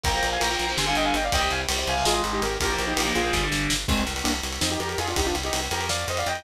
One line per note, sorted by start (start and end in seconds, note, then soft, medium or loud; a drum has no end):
0.04 0.20 A#1 medium
0.04 0.11 F3 loud
0.04 0.11 A#3 loud
0.04 0.30 G5 medium
0.04 0.30 A#5 loud
0.04 kick loud
0.04 ride medium
0.14 0.36 F3 medium
0.14 0.36 A#3 loud
0.23 0.38 A#1 medium
0.23 ride medium
0.32 0.41 F5 medium
0.32 0.41 G#5 medium
0.40 0.57 A#1 medium
0.40 0.48 F3 medium
0.40 0.48 A#3 loud
0.40 0.71 G5 medium
0.40 0.71 A#5 medium
0.40 ride loud
0.51 0.65 F3 medium
0.51 0.65 A#3 medium
0.59 0.75 A#1 medium
0.59 ride medium
0.69 0.76 F3 medium
0.69 0.76 A#3 medium
0.77 0.93 G1 medium
0.77 0.84 D3 loud
0.77 0.84 G3 loud
0.77 0.87 G#5 medium
0.77 0.87 C6 medium
0.77 snare medium
0.86 1.15 D3 loud
0.86 1.15 G3 medium
0.86 0.96 F5 medium
0.86 0.96 G#5 medium
0.95 1.11 G1 medium
0.95 1.05 D#5 medium
0.95 1.05 G5 medium
0.95 ride medium
1.05 1.14 F5 medium
1.05 1.14 G#5 medium
1.14 1.30 G1 medium
1.14 1.24 D#5 medium
1.14 1.24 G5 medium
1.14 ride medium
1.24 1.33 D5 medium
1.24 1.33 F5 loud
1.32 1.48 C2 medium
1.32 1.39 C3 loud
1.32 1.39 G3 loud
1.32 1.51 D#5 loud
1.32 1.51 G5 loud
1.32 kick medium
1.32 ride medium
1.40 1.62 C3 medium
1.40 1.62 G3 medium
1.51 1.66 C2 medium
1.51 1.60 F5 medium
1.51 1.60 G#5 medium
1.51 ride medium
1.69 1.84 C2 medium
1.69 1.76 C3 medium
1.69 1.76 G3 medium
1.69 ride loud
1.78 1.93 C3 medium
1.78 1.93 G3 medium
1.87 2.03 C2 medium
1.87 2.05 F5 medium
1.87 2.05 G#5 medium
1.87 ride medium
1.97 2.05 C3 medium
1.97 2.05 G3 medium
2.05 2.21 G#1 medium
2.05 2.13 D#3 loud
2.05 2.13 G#3 loud
2.05 2.22 F4 medium
2.05 2.22 G#4 medium
2.05 snare loud
2.14 2.43 D#3 medium
2.14 2.43 G#3 loud
2.24 2.39 G#1 medium
2.24 ride medium
2.33 2.41 D#4 medium
2.33 2.41 G4 medium
2.42 2.58 G#1 medium
2.42 2.58 G4 medium
2.42 2.58 A#4 medium
2.42 ride medium
2.60 2.76 A#1 medium
2.60 2.69 F3 loud
2.60 2.69 A#3 loud
2.60 2.83 G4 medium
2.60 2.83 A#4 loud
2.60 kick medium
2.60 ride loud
2.70 2.92 F3 loud
2.70 2.92 A#3 medium
2.79 2.94 A#1 medium
2.79 ride medium
2.87 3.11 D#4 medium
2.87 3.11 G4 loud
2.97 3.12 A#1 medium
2.97 3.05 F3 medium
2.97 3.05 A#3 loud
2.97 ride loud
3.05 3.20 F3 medium
3.05 3.20 A#3 medium
3.15 3.31 A#1 medium
3.15 3.46 F4 medium
3.15 3.46 G#4 medium
3.15 ride medium
3.24 3.31 F3 loud
3.24 3.31 A#3 medium
3.33 3.49 G1 medium
3.33 3.40 D3 loud
3.33 3.40 G3 loud
3.33 kick medium
3.33 snare medium
3.43 3.72 D3 medium
3.43 3.72 G3 medium
3.52 3.67 G1 medium
3.52 snare medium
3.70 3.86 G1 medium
3.70 snare loud
3.88 4.04 C2 loud
3.88 4.03 G#3 medium
3.88 4.03 C4 loud
3.88 kick loud
3.88 crash medium
3.97 ride medium
4.07 4.22 C2 medium
4.07 ride medium
4.16 ride medium
4.24 4.41 C2 loud
4.24 4.32 A#3 medium
4.24 4.32 D4 medium
4.24 ride loud
4.34 ride medium
4.43 4.59 C2 medium
4.43 ride medium
4.53 ride medium
4.61 4.77 F2 loud
4.61 4.69 C4 medium
4.61 4.69 D#4 medium
4.61 snare loud
4.70 4.80 D#4 medium
4.70 4.79 G4 medium
4.70 ride medium
4.80 4.95 F2 medium
4.80 4.89 G4 medium
4.80 4.89 A#4 medium
4.80 ride medium
4.89 4.98 G4 medium
4.89 4.98 A#4 medium
4.89 ride medium
4.98 5.14 F2 loud
4.98 5.07 F4 medium
4.98 5.07 G#4 loud
4.98 ride medium
5.08 5.17 D4 medium
5.08 5.17 F4 medium
5.08 ride medium
5.16 5.32 C2 loud
5.16 5.26 D#4 medium
5.16 5.26 G4 medium
5.16 kick medium
5.16 ride loud
5.26 5.35 D4 medium
5.26 5.35 F4 medium
5.26 ride medium
5.35 5.50 C2 medium
5.35 ride medium
5.43 5.60 D#4 medium
5.43 5.60 G4 medium
5.43 ride medium
5.53 5.69 C2 medium
5.53 ride loud
5.62 ride medium
5.71 6.05 F2 loud
5.71 5.88 G4 medium
5.71 5.88 A#4 medium
5.71 ride medium
5.81 ride medium
5.89 6.06 D5 medium
5.89 6.06 F5 medium
5.89 snare loud
5.99 ride medium
6.08 6.23 F2 medium
6.08 6.18 C5 medium
6.08 6.18 D#5 medium
6.08 ride medium
6.17 6.27 D5 medium
6.17 6.27 F5 loud
6.17 ride medium
6.26 6.42 F2 medium
6.26 6.44 D#5 medium
6.26 6.44 G5 medium
6.26 ride medium
6.35 ride medium